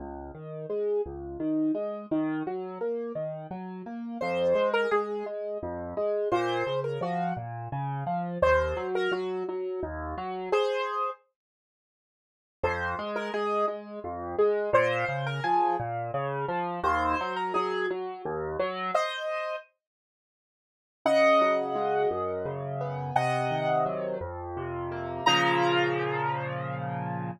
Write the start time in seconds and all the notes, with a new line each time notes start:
0.00 C#2
0.35 D#3
0.70 G#3
1.06 C#2
1.40 D#3
1.75 G#3
2.11 D#3
2.47 F#3
2.81 A#3
3.15 D#3
3.51 F#3
3.86 A#3
4.21 F2 C5
4.55 G#3
4.74 A#4
4.91 G#3 G#4
5.26 G#3
5.63 F2
5.97 G#3
6.32 A#2 C5
6.67 C#3
6.84 A#4
7.01 F3 F#4
7.37 A#2
7.72 C#3
8.07 F3
8.42 D#2 C5
8.77 F#3
8.95 A#4
9.12 F#3 F#4
9.49 F#3
9.83 D#2
10.18 F#3
10.52 G#4 C5
12.63 F2 C5
12.99 G#3
13.16 A#4
13.34 G#3 G#4
13.68 G#3
14.04 F2
14.38 G#3
14.73 A#2 C5
15.09 C#3
15.27 A#4
15.44 F3 G#4
15.80 A#2
16.14 C#3
16.49 F3
16.83 D#2 C5
17.21 F#3
17.36 A#4
17.54 F#3 G#4
17.90 F#3
18.25 D#2
18.60 F#3
18.94 C5 D#5
21.05 C#3 D#5 F#5
21.41 F#3
21.75 G#3
22.11 F#2
22.45 C#3
22.81 B3
23.16 C3 D#5 F#5
23.51 D#3
23.86 F#3
24.21 F2
24.57 C3
24.92 A#3
25.26 A#2 C#3 F3 A#5